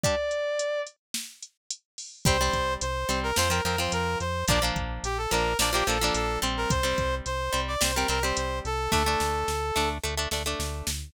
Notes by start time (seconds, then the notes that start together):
0.03 G3 D4 D5, kick, closed hi-hat
0.31 closed hi-hat
0.59 closed hi-hat
0.87 closed hi-hat
1.14 snare
1.42 closed hi-hat
1.70 closed hi-hat
1.98 open hi-hat
2.25 C2 G3 C4 C5, kick, closed hi-hat
2.41 G3 C4
2.53 C2, kick, closed hi-hat
2.81 C2 C5, closed hi-hat
3.09 C2 G3 C4, closed hi-hat
3.23 A#4
3.36 F2 F3 C4 C5, snare
3.50 F3 C4 A#4
3.65 F2 F3 C4 A#4, closed hi-hat
3.78 F3 C4 C5
3.92 F2 A#4, closed hi-hat
4.20 F2 C5, closed hi-hat
4.48 A#1 F3 A#3 D4 D5, kick, closed hi-hat
4.62 F3 A#3 D4
4.76 A#1, kick, closed hi-hat
5.03 A#1 G4, closed hi-hat
5.18 A4
5.31 A#1 F3 A#3 D4 A#4, closed hi-hat
5.59 A#1 F3 A#3 D4 D5, snare
5.73 F3 A#3 D4 G4
5.87 A#1 F3 A#3 D4 A4, closed hi-hat
6.01 F3 A#3 D4
6.14 A#1 A4, closed hi-hat
6.42 A#1 G3 C4, closed hi-hat
6.57 A#4
6.70 C2 C5, kick, closed hi-hat
6.83 G3 C4
6.98 C2, kick, closed hi-hat
7.26 C2 C5, closed hi-hat
7.53 C2 G3 C4, closed hi-hat
7.68 D5
7.81 C2 G3 C4 C5, snare
7.95 G3 C4 A#4
8.08 C2 G3 C4 A#4, closed hi-hat
8.23 G3 C4 C5
8.37 C2 C5, closed hi-hat
8.65 C2 A4, closed hi-hat
8.92 D2 A3 D4 A4, kick, snare
9.06 A3 D4
9.20 D2, snare
9.48 D2, snare
9.76 D2 A3 D4, snare
10.03 D2 A3 D4
10.17 A3 D4
10.31 D2 A3 D4, snare
10.46 A3 D4
10.59 D2, snare
10.87 D2, snare